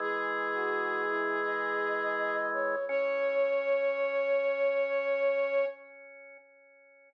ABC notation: X:1
M:4/4
L:1/16
Q:1/4=83
K:C#phr
V:1 name="Ocarina"
G16 | c16 |]
V:2 name="Flute"
z3 F3 E2 ^d6 c2 | c16 |]
V:3 name="Drawbar Organ"
[E,G,]16 | C16 |]